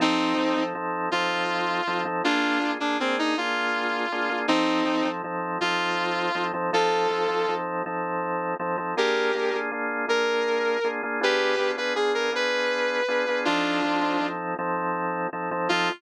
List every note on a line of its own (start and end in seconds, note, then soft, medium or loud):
0.00 0.34 F3 medium
0.00 0.34 C4 medium
0.00 0.63 C4 medium
0.00 0.34 D#4 medium
0.00 0.63 D#4 medium
0.00 0.34 A4 medium
0.37 0.55 F3 medium
0.37 0.55 C4 medium
0.37 0.55 D#4 medium
0.37 0.55 A4 medium
0.57 0.74 F3 medium
0.57 0.74 C4 medium
0.57 0.74 D#4 medium
0.57 0.74 A4 medium
0.75 1.09 F3 medium
0.75 1.09 C4 medium
0.75 1.09 D#4 medium
0.75 1.09 A4 medium
1.11 1.81 F3 medium
1.11 1.81 C4 medium
1.11 1.81 D#4 medium
1.11 2.01 F4 medium
1.11 1.81 A4 medium
1.87 2.05 F3 medium
1.87 2.05 C4 medium
1.87 2.05 D#4 medium
1.87 2.05 A4 medium
2.05 2.22 F3 medium
2.05 2.22 C4 medium
2.05 2.22 D#4 medium
2.05 2.22 A4 medium
2.24 2.59 A#3 medium
2.24 2.71 D4 medium
2.24 2.59 D4 medium
2.24 2.71 F4 medium
2.24 2.59 F4 medium
2.24 2.59 G#4 medium
2.61 2.78 A#3 medium
2.61 2.78 D4 medium
2.61 2.78 F4 medium
2.61 2.78 G#4 medium
2.80 2.98 A#3 medium
2.80 2.97 D4 medium
2.80 2.98 D4 medium
2.80 2.98 F4 medium
2.80 2.98 G#4 medium
3.00 3.35 A#3 medium
3.00 3.16 C4 medium
3.00 3.35 D4 medium
3.00 3.35 F4 medium
3.00 3.35 G#4 medium
3.19 3.36 D#4 medium
3.37 4.06 A#3 medium
3.37 4.06 D4 medium
3.37 4.06 F4 medium
3.37 4.39 F4 medium
3.37 4.06 G#4 medium
4.12 4.29 A#3 medium
4.12 4.29 D4 medium
4.12 4.29 F4 medium
4.12 4.29 G#4 medium
4.30 4.47 A#3 medium
4.30 4.47 D4 medium
4.30 4.47 F4 medium
4.30 4.47 G#4 medium
4.48 4.83 F3 medium
4.48 5.08 C4 medium
4.48 4.83 C4 medium
4.48 5.08 D#4 medium
4.48 4.83 D#4 loud
4.48 4.83 A4 medium
4.85 5.03 F3 medium
4.85 5.03 C4 medium
4.85 5.03 D#4 medium
4.85 5.03 A4 medium
5.05 5.22 F3 medium
5.05 5.22 C4 medium
5.05 5.22 D#4 medium
5.05 5.22 A4 medium
5.24 5.58 F3 medium
5.24 5.58 C4 medium
5.24 5.58 D#4 medium
5.24 5.58 A4 medium
5.61 6.30 F3 medium
5.61 6.30 C4 medium
5.61 6.30 D#4 medium
5.61 6.44 F4 medium
5.61 6.30 A4 medium
6.35 6.52 F3 medium
6.35 6.52 C4 medium
6.35 6.52 D#4 medium
6.35 6.52 A4 medium
6.54 6.71 F3 medium
6.54 6.71 C4 medium
6.54 6.71 D#4 medium
6.54 6.71 A4 medium
6.73 7.07 F3 medium
6.73 7.07 C4 medium
6.73 7.07 D#4 medium
6.73 7.53 F4 medium
6.73 7.07 A4 medium
6.73 7.53 A4 medium
7.10 7.27 F3 medium
7.10 7.27 C4 medium
7.10 7.27 D#4 medium
7.10 7.27 A4 medium
7.29 7.46 F3 medium
7.29 7.46 C4 medium
7.29 7.46 D#4 medium
7.29 7.46 A4 medium
7.48 7.83 F3 medium
7.48 7.83 C4 medium
7.48 7.83 D#4 medium
7.48 7.83 A4 medium
7.86 8.55 F3 medium
7.86 8.55 C4 medium
7.86 8.55 D#4 medium
7.86 8.55 A4 medium
8.60 8.77 F3 medium
8.60 8.77 C4 medium
8.60 8.77 D#4 medium
8.60 8.77 A4 medium
8.77 8.95 F3 medium
8.77 8.95 C4 medium
8.77 8.95 D#4 medium
8.77 8.95 A4 medium
8.97 9.32 A#3 medium
8.97 9.32 D4 medium
8.97 9.32 F4 medium
8.97 9.57 G4 medium
8.97 9.32 G#4 medium
8.97 9.57 A#4 medium
9.35 9.52 A#3 medium
9.35 9.52 D4 medium
9.35 9.52 F4 medium
9.35 9.52 G#4 medium
9.53 9.71 A#3 medium
9.53 9.71 D4 medium
9.53 9.71 F4 medium
9.53 9.71 G#4 medium
9.71 10.06 A#3 medium
9.71 10.06 D4 medium
9.71 10.06 F4 medium
9.71 10.06 G#4 medium
10.08 10.77 A#3 medium
10.08 10.77 D4 medium
10.08 10.77 F4 medium
10.08 10.77 G#4 medium
10.08 10.88 A#4 medium
10.84 11.02 A#3 medium
10.84 11.02 D4 medium
10.84 11.02 F4 medium
10.84 11.02 G#4 medium
11.03 11.20 A#3 medium
11.03 11.20 D4 medium
11.03 11.20 F4 medium
11.03 11.20 G#4 medium
11.21 11.55 B3 medium
11.21 11.55 D4 loud
11.21 11.55 F4 medium
11.21 11.71 G4 medium
11.21 11.55 G#4 medium
11.21 11.71 B4 medium
11.59 11.76 B3 medium
11.59 11.76 D4 medium
11.59 11.76 F4 medium
11.59 11.76 G#4 medium
11.77 11.94 B3 medium
11.77 11.94 D4 medium
11.77 11.94 F4 medium
11.77 11.94 G#4 medium
11.77 11.93 B4 medium
11.96 12.30 B3 medium
11.96 12.30 D4 medium
11.96 12.30 F4 medium
11.96 12.12 G#4 medium
11.96 12.30 G#4 medium
12.15 12.31 A#4 medium
12.32 13.01 B3 medium
12.32 13.01 D4 medium
12.32 13.01 F4 medium
12.32 13.01 G#4 medium
12.32 13.40 B4 medium
13.08 13.26 B3 medium
13.08 13.26 D4 medium
13.08 13.26 F4 medium
13.08 13.26 G#4 medium
13.28 13.45 B3 medium
13.28 13.45 D4 medium
13.28 13.45 F4 medium
13.28 13.45 G#4 medium
13.45 13.81 F3 medium
13.45 13.81 C4 medium
13.45 14.27 D4 medium
13.45 13.81 D#4 medium
13.45 14.27 F4 medium
13.45 13.81 A4 medium
13.84 14.01 F3 medium
13.84 14.01 C4 medium
13.84 14.01 D#4 medium
13.84 14.01 A4 medium
14.01 14.18 F3 medium
14.01 14.18 C4 medium
14.01 14.18 D#4 medium
14.01 14.18 A4 medium
14.20 14.55 F3 medium
14.20 14.55 C4 medium
14.20 14.55 D#4 medium
14.20 14.55 A4 medium
14.59 15.27 F3 medium
14.59 15.27 C4 medium
14.59 15.27 D#4 medium
14.59 15.27 A4 medium
15.33 15.50 F3 medium
15.33 15.50 C4 medium
15.33 15.50 D#4 medium
15.33 15.50 A4 medium
15.51 15.68 F3 medium
15.51 15.68 C4 medium
15.51 15.68 D#4 medium
15.51 15.68 A4 medium
15.69 15.90 F3 loud
15.69 15.90 C4 medium
15.69 15.90 D#4 loud
15.69 15.89 F4 loud
15.69 15.90 A4 loud